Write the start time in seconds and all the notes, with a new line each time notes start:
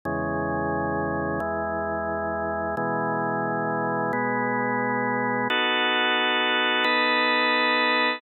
0.05 E2 C#3 G#3
1.40 E2 E3 G#3
2.77 B2 E3 G#3
4.13 B2 G#3 B3
5.50 B3 D#4 F#4 A4
6.84 B3 D#4 A4 B4